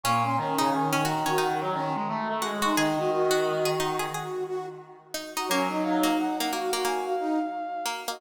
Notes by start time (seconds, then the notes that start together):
0.04 A#2 A#3 C#4 C#6
0.23 C#4 C6
0.37 D#3 C#4 A#5
0.59 C#3 D#4 A#5
0.71 D#3 G#5
0.93 D#3 C#4 G#5
1.05 D#4 F#4 A#5
1.26 D#3 C#4 F#4
1.38 D#4 F#5
1.61 F#3 A#5
1.74 D#3 C#4
1.95 G#3
2.08 A3
2.29 A3
2.42 G#3 F#4
2.62 D#4 F#4 C6
2.76 D#3 D#4 G#4 D#5
2.97 D#3 F#4
3.11 D#3 F#4
3.31 F#4
3.65 G#4
3.79 D#4 F#4
3.99 F#4 G#4
4.14 G#4
4.47 F#4
5.14 D#4
5.37 D#4 F#4
5.49 F#3 A#3 C#4 C#5
5.69 D#4 D#5
5.83 D#4 F5
6.03 A#3 F5
6.18 F#5
6.39 A#3 F#5
6.51 A#3 F#4 F5
6.73 A#3 F#4
6.85 A#3 G#5
7.06 F5
7.20 D#4
7.86 A#3
8.08 A#3 F#4 D#5